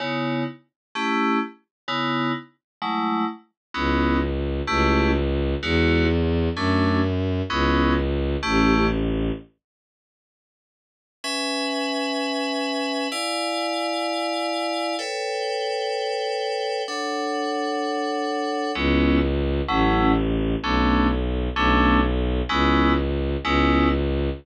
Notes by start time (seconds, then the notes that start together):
0.00 C#3 B3 D#4 E4
0.95 A3 C#4 E4 G4
1.88 C#3 B3 D#4 E4
2.82 F#3 G#3 A3 E4
3.74 C#2 B3 C#4 D#4 E4
4.67 C#2 A3 C#4 E4 G4
5.63 E2 G#3 D#4 E4 F#4
6.56 F#2 A3 C#4 D4 F#4
7.50 C#2 B3 C#4 D#4 E4
8.43 A1 A3 C#4 E4 G4
11.24 C#4 B4 E5 G#5
13.12 E4 D5 F5 G#5
14.99 A4 B4 C#5 G5
16.88 D4 A4 C#5 F#5
18.75 C#2 G#3 B3 C#4 E4
19.68 A1 F#3 A3 C#4 E4
20.63 B1 A3 B3 C#4 D4
21.56 B1 A3 B3 C#4 D4
22.49 C#2 G#3 B3 C#4 E4
23.43 C#2 G#3 B3 C#4 E4